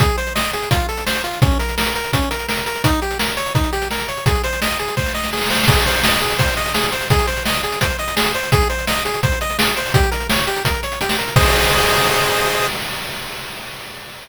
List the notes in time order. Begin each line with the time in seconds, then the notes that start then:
0.00 G#4, kick, closed hi-hat
0.09 closed hi-hat
0.18 C5, closed hi-hat
0.27 closed hi-hat
0.35 D#5, snare
0.44 closed hi-hat
0.53 G#4, closed hi-hat
0.63 closed hi-hat
0.71 F4, kick, closed hi-hat
0.80 closed hi-hat
0.89 A4, closed hi-hat
0.97 closed hi-hat
1.06 C5, snare
1.16 closed hi-hat
1.24 F4, closed hi-hat
1.33 closed hi-hat
1.42 C#4, kick, closed hi-hat
1.51 closed hi-hat
1.59 A#4, closed hi-hat
1.69 closed hi-hat
1.78 A#4, snare
1.86 closed hi-hat
1.95 A#4, closed hi-hat
2.04 closed hi-hat
2.13 C#4, kick, closed hi-hat
2.22 closed hi-hat
2.31 A#4, closed hi-hat
2.39 closed hi-hat
2.49 A#4, snare
2.57 closed hi-hat
2.66 A#4, closed hi-hat
2.75 closed hi-hat
2.84 D#4, kick, closed hi-hat
2.93 closed hi-hat
3.02 G4, closed hi-hat
3.11 closed hi-hat
3.19 A#4, snare
3.29 closed hi-hat
3.37 C#5, closed hi-hat
3.46 closed hi-hat
3.55 D#4, kick, closed hi-hat
3.64 closed hi-hat
3.73 G4, closed hi-hat
3.82 closed hi-hat
3.91 A#4, snare
4.00 closed hi-hat
4.08 C#5, closed hi-hat
4.17 closed hi-hat
4.26 G#4, kick, closed hi-hat
4.35 closed hi-hat
4.44 C5, closed hi-hat
4.53 closed hi-hat
4.62 D#5, snare
4.70 closed hi-hat
4.79 G#4, closed hi-hat
4.88 closed hi-hat
4.97 C5, kick, snare
5.06 snare
5.14 D#5, snare
5.24 snare
5.33 G#4, snare
5.37 snare
5.41 snare
5.46 snare
5.50 C5, snare
5.55 snare
5.59 snare
5.63 snare
5.68 G#4, kick, crash
5.77 closed hi-hat
5.86 C5, closed hi-hat
5.94 closed hi-hat
6.03 D#5, snare
6.12 closed hi-hat
6.21 G#4, closed hi-hat
6.31 closed hi-hat
6.38 C5, kick, closed hi-hat
6.48 closed hi-hat
6.57 D#5, closed hi-hat
6.66 closed hi-hat
6.74 G#4, snare
6.83 closed hi-hat
6.92 C5, closed hi-hat
7.01 closed hi-hat
7.10 G#4, kick, closed hi-hat
7.19 closed hi-hat
7.27 C5, closed hi-hat
7.37 closed hi-hat
7.46 D#5, snare
7.54 closed hi-hat
7.63 G#4, closed hi-hat
7.72 closed hi-hat
7.81 C5, kick, closed hi-hat
7.90 closed hi-hat
7.99 D#5, closed hi-hat
8.08 closed hi-hat
8.16 G#4, snare
8.25 closed hi-hat
8.34 C5, closed hi-hat
8.43 closed hi-hat
8.52 G#4, kick, closed hi-hat
8.61 closed hi-hat
8.70 C5, closed hi-hat
8.79 closed hi-hat
8.87 D#5, snare
8.97 closed hi-hat
9.05 G#4, closed hi-hat
9.14 closed hi-hat
9.23 C5, kick, closed hi-hat
9.32 closed hi-hat
9.41 D#5, closed hi-hat
9.50 closed hi-hat
9.59 G#4, snare
9.68 closed hi-hat
9.76 C5, closed hi-hat
9.86 open hi-hat
9.94 G4, kick, closed hi-hat
10.03 closed hi-hat
10.11 A#4, closed hi-hat
10.20 closed hi-hat
10.30 C#5, snare
10.38 closed hi-hat
10.47 G4, closed hi-hat
10.56 closed hi-hat
10.65 A#4, kick, closed hi-hat
10.74 closed hi-hat
10.83 C#5, closed hi-hat
10.92 closed hi-hat
11.01 G4, closed hi-hat
11.09 snare
11.18 A#4, closed hi-hat
11.28 closed hi-hat
11.36 G#4 C5 D#5, kick, crash